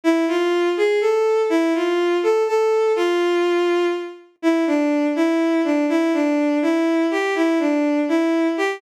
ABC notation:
X:1
M:6/8
L:1/8
Q:3/8=82
K:Am
V:1 name="Violin"
E F2 ^G A2 | E F2 A A2 | F4 z2 | E D2 E2 D |
E D2 E2 G | E D2 E2 G |]